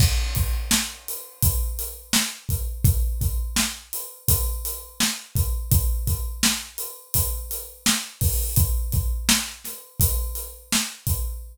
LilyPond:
\new DrumStaff \drummode { \time 4/4 \tempo 4 = 84 <cymc bd>8 <hh bd>8 sn8 hh8 <hh bd>8 hh8 sn8 <hh bd>8 | <hh bd>8 <hh bd>8 sn8 hh8 <hh bd>8 hh8 sn8 <hh bd>8 | <hh bd>8 <hh bd>8 sn8 hh8 <hh bd>8 hh8 sn8 <hho bd>8 | <hh bd>8 <hh bd>8 sn8 <hh sn>8 <hh bd>8 hh8 sn8 <hh bd>8 | }